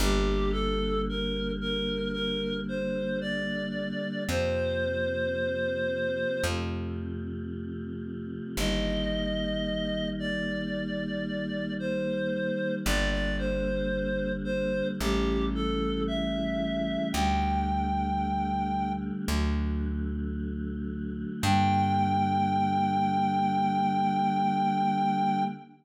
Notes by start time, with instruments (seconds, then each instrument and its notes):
0.00 electric bass (finger) G1, choir aahs D3 G3 A#3, clarinet G4
0.52 clarinet A4
1.09 clarinet A#4
1.61 clarinet A#4
2.13 clarinet A#4
2.69 clarinet C5
3.21 clarinet D5
4.27 electric bass (finger) F2, choir aahs C3 F3 A#3, clarinet C5
6.44 electric bass (finger) F2, choir aahs C3 F3 A3
8.57 electric bass (finger) G1, choir aahs D#3 G3 A#3, clarinet D#5
10.19 clarinet D5
11.79 clarinet C5
12.85 electric bass (finger) G1, choir aahs D3 G3 A#3, clarinet D5
13.11 clarinet D5
13.38 clarinet C5
14.44 clarinet C5
14.99 electric bass (finger) A1, choir aahs C#3 E3 G3 A3, clarinet G4
15.55 clarinet A4
16.07 clarinet E5
17.13 electric bass (finger) D2, choir aahs D3 G3 A3, clarinet G5
19.28 electric bass (finger) D2, choir aahs D3 F#3 A3
21.42 electric bass (finger) G2, choir aahs D3 G3 A#3, clarinet G5